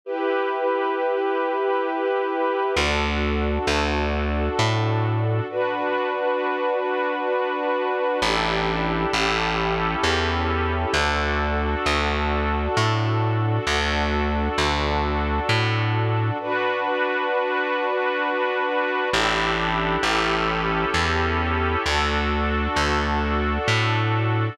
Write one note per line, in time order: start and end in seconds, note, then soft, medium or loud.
0.04 2.74 E4 medium
0.04 2.74 G4 medium
0.04 2.74 B4 medium
2.76 3.58 D2 medium
2.76 5.46 D4 medium
2.76 5.46 F#4 medium
2.76 5.46 A4 medium
3.67 4.49 D2 medium
4.59 5.41 A2 medium
5.49 8.19 D4 medium
5.49 8.19 F#4 medium
5.49 8.19 B4 medium
8.22 9.05 A1 medium
8.22 9.13 D4 medium
8.22 9.12 E4 medium
8.22 9.12 G4 medium
8.22 9.12 A4 medium
9.13 9.95 A1 medium
9.13 10.93 C#4 medium
9.13 10.93 E4 medium
9.13 10.93 G4 medium
9.13 10.93 A4 medium
10.03 10.85 E2 medium
10.93 11.75 D2 medium
10.93 13.64 D4 medium
10.93 13.64 F#4 medium
10.93 13.64 A4 medium
11.86 12.68 D2 medium
12.77 13.59 A2 medium
13.67 14.48 D2 medium
13.67 16.37 D4 medium
13.67 16.37 F#4 medium
13.67 16.37 A4 medium
14.58 15.40 D2 medium
15.49 16.31 A2 medium
16.39 19.09 D4 medium
16.39 19.09 F#4 medium
16.39 19.09 B4 medium
19.12 19.97 A1 loud
19.12 20.02 D4 loud
19.12 20.02 E4 medium
19.12 20.02 G4 medium
19.12 20.02 A4 medium
20.03 20.85 A1 medium
20.03 21.83 C#4 medium
20.03 21.83 E4 medium
20.03 21.83 G4 medium
20.03 21.83 A4 loud
20.94 21.76 E2 medium
21.85 22.67 D2 medium
21.85 24.55 D4 medium
21.85 24.55 F#4 medium
21.85 24.55 A4 loud
22.76 23.58 D2 medium
23.68 24.49 A2 medium